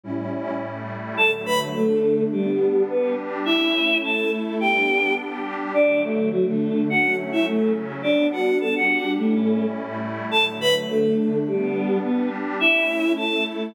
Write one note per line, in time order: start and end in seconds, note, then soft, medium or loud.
0.03 0.60 A2 medium
0.03 0.60 G3 medium
0.03 0.60 C#4 medium
0.03 0.60 E4 medium
0.60 1.17 A2 medium
0.60 1.17 G3 medium
0.60 1.17 A3 medium
0.60 1.17 E4 medium
1.17 1.74 D3 medium
1.17 1.75 F#3 medium
1.17 1.74 A3 medium
1.17 1.31 A4 medium
1.17 1.31 A5 medium
1.46 1.59 B4 medium
1.46 1.59 B5 medium
1.75 2.32 D3 medium
1.75 2.32 A3 medium
1.75 2.24 A3 medium
1.75 2.31 D4 medium
1.75 2.24 A4 medium
2.32 2.83 G3 medium
2.32 2.88 G3 medium
2.32 2.88 B3 medium
2.32 2.88 D4 medium
2.32 2.83 G4 medium
2.89 3.46 G3 medium
2.89 3.15 B3 medium
2.89 3.46 D4 medium
2.89 3.46 G4 medium
2.89 3.15 B4 medium
3.45 4.03 A3 medium
3.45 4.03 C#4 medium
3.45 3.98 E4 medium
3.45 4.03 E4 medium
3.45 3.98 E5 medium
4.03 4.60 A3 medium
4.03 4.60 E4 medium
4.03 4.60 A4 medium
4.03 4.31 A4 medium
4.03 4.31 A5 medium
4.60 5.17 G3 medium
4.60 5.17 B3 medium
4.60 5.17 D4 medium
4.60 5.14 G4 medium
4.60 5.14 G5 medium
5.18 5.74 G3 medium
5.18 5.74 D4 medium
5.18 5.74 G4 medium
5.74 6.31 D3 medium
5.74 6.32 F#3 medium
5.74 6.31 A3 medium
5.74 6.01 D4 medium
5.74 6.01 D5 medium
6.03 6.29 A3 medium
6.03 6.29 A4 medium
6.32 6.88 D3 medium
6.32 6.45 F#3 medium
6.32 6.88 A3 medium
6.32 6.88 D4 medium
6.32 6.45 F#4 medium
6.47 6.82 A3 medium
6.47 6.82 A4 medium
6.89 7.46 F#3 medium
6.89 7.46 A3 medium
6.89 7.46 C#4 medium
6.89 7.16 F#4 medium
6.89 7.16 F#5 medium
7.32 7.46 E4 medium
7.32 7.46 E5 medium
7.46 8.03 C#3 medium
7.46 8.03 F#3 medium
7.46 7.72 A3 medium
7.46 8.03 C#4 medium
7.46 7.72 A4 medium
8.03 8.60 G3 medium
8.03 8.60 B3 medium
8.03 8.27 D4 medium
8.03 8.60 D4 medium
8.03 8.27 D5 medium
8.32 8.58 F#4 medium
8.32 8.58 F#5 medium
8.60 9.17 G3 medium
8.60 9.17 D4 medium
8.60 9.17 G4 medium
8.60 8.74 A4 medium
8.60 8.74 A5 medium
8.75 9.11 F#4 medium
8.75 9.11 F#5 medium
9.18 9.74 A2 medium
9.18 9.74 G3 medium
9.18 9.66 A3 medium
9.18 9.74 C#4 loud
9.18 9.74 E4 medium
9.18 9.66 A4 medium
9.75 10.31 A2 medium
9.75 10.31 G3 medium
9.75 10.31 A3 medium
9.75 10.31 E4 medium
10.31 10.88 D3 medium
10.31 10.88 F#3 medium
10.31 10.88 A3 medium
10.31 10.45 A4 medium
10.31 10.45 A5 medium
10.61 10.74 B4 medium
10.61 10.74 B5 medium
10.89 11.46 D3 medium
10.89 11.46 A3 medium
10.89 11.39 A3 medium
10.89 11.46 D4 medium
10.89 11.39 A4 medium
11.46 12.03 G3 medium
11.46 11.98 G3 medium
11.46 12.03 B3 medium
11.46 12.03 D4 medium
11.46 11.98 G4 medium
12.03 12.60 G3 medium
12.03 12.29 B3 medium
12.03 12.60 D4 medium
12.03 12.60 G4 medium
12.03 12.29 B4 medium
12.60 13.17 A3 medium
12.60 13.17 C#4 medium
12.60 13.12 E4 medium
12.60 13.17 E4 medium
12.60 13.12 E5 medium
13.17 13.74 A3 medium
13.17 13.74 E4 medium
13.17 13.44 A4 medium
13.17 13.74 A4 medium
13.17 13.44 A5 medium